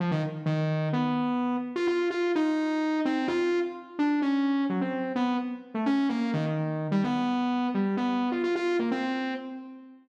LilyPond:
\new Staff { \time 5/4 \tempo 4 = 128 f16 ees16 r8 ees4 b4. r16 f'16 f'8 f'8 | ees'4. c'8 f'8. r8. d'8 des'4 | ges16 c'8. b8 r8. a16 des'8 bes8 ees16 ees4 g16 | b4. g8 b8. f'16 f'16 f'8 bes16 c'4 | }